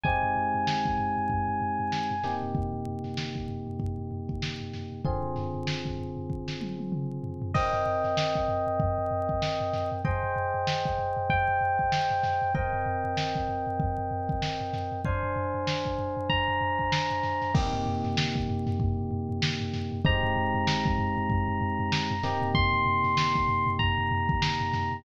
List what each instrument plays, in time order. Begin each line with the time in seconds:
0.04 electric piano 1 G#3 C4 D#4 G4 G#5, kick, floor tom
0.23 floor tom
0.36 floor tom
0.54 floor tom
0.67 snare
0.85 kick, floor tom
0.98 floor tom
1.17 floor tom
1.30 kick, floor tom
1.48 floor tom
1.61 floor tom
1.79 floor tom
1.92 snare
2.10 floor tom
2.23 electric piano 1 C3 A#3 D#4 G4, snare, floor tom
2.42 floor tom
2.55 kick, floor tom
2.73 floor tom
2.86 floor tom
3.04 snare, floor tom
3.17 snare
3.35 kick, floor tom
3.48 floor tom
3.67 floor tom
3.80 kick, floor tom
3.98 floor tom
4.11 floor tom
4.29 kick, floor tom
4.42 snare
4.60 floor tom
4.73 snare, floor tom
4.92 floor tom
5.05 electric piano 1 D3 C4 F4 G#4, kick, floor tom
5.23 floor tom
5.36 snare, floor tom
5.54 floor tom
5.67 snare
5.85 kick, floor tom
5.98 floor tom
6.17 floor tom
6.30 kick
6.48 snare
6.61 high tom
6.79 high tom
6.92 mid tom
7.23 floor tom
7.42 floor tom
7.54 electric piano 1 C4 A#4 D#5 G5, kick, crash
7.73 snare, floor tom
7.86 floor tom
8.04 snare, floor tom
8.17 snare
8.35 kick, floor tom
8.48 floor tom
8.67 floor tom
8.80 kick, floor tom
8.98 floor tom
9.11 floor tom
9.29 kick, floor tom
9.42 snare
9.60 floor tom
9.73 snare, floor tom
9.92 floor tom
10.05 electric piano 1 G#4 C5 D#5 G5, kick, floor tom
10.23 floor tom
10.36 floor tom
10.54 floor tom
10.67 snare
10.85 kick, floor tom
10.99 floor tom
11.17 floor tom
11.30 electric piano 1 G5, kick, floor tom
11.48 floor tom
11.61 floor tom
11.79 kick, floor tom
11.92 snare
12.10 snare, floor tom
12.23 snare, floor tom
12.42 floor tom
12.55 electric piano 1 C4 A#4 D#5 G5, kick, floor tom
12.73 floor tom
12.86 floor tom
13.04 floor tom
13.17 snare
13.35 kick, floor tom
13.48 floor tom
13.67 floor tom
13.80 kick, floor tom
13.98 floor tom
14.11 floor tom
14.29 kick, floor tom
14.42 snare
14.60 floor tom
14.73 snare, floor tom
14.92 floor tom
15.05 electric piano 1 D4 C5 F5 G#5, kick, floor tom
15.23 floor tom
15.36 floor tom
15.54 floor tom
15.67 snare
15.85 kick, floor tom
15.98 floor tom
16.17 floor tom
16.30 electric piano 1 A#5, kick, floor tom
16.48 floor tom
16.61 floor tom
16.79 kick, floor tom
16.92 snare
17.11 floor tom
17.23 snare, floor tom
17.42 snare, floor tom
17.54 electric piano 1 C3 A#3 D#4 G4, kick, crash
17.73 floor tom
17.86 floor tom
18.04 snare, floor tom
18.17 snare
18.35 kick, floor tom
18.48 floor tom
18.67 snare, floor tom
18.80 kick, floor tom
18.98 floor tom
19.11 floor tom
19.29 floor tom
19.42 snare
19.60 floor tom
19.73 snare, floor tom
19.92 floor tom
20.05 electric piano 1 G#3 C4 D#4 G4 A#5, kick, floor tom
20.23 floor tom
20.36 floor tom
20.54 floor tom
20.67 snare
20.85 kick, floor tom
20.98 floor tom
21.17 floor tom
21.30 kick, floor tom
21.48 floor tom
21.61 floor tom
21.79 floor tom
21.92 snare
22.10 floor tom
22.23 electric piano 1 C3 A#3 D#4 G4, snare, floor tom
22.42 floor tom
22.55 electric piano 1 C6, kick, floor tom
22.73 floor tom
22.86 floor tom
23.04 snare, floor tom
23.17 snare
23.36 kick, floor tom
23.48 floor tom
23.67 floor tom
23.79 electric piano 1 A#5, kick, floor tom
23.98 floor tom
24.11 floor tom
24.29 kick, floor tom
24.42 snare
24.60 floor tom
24.73 snare, floor tom
24.92 floor tom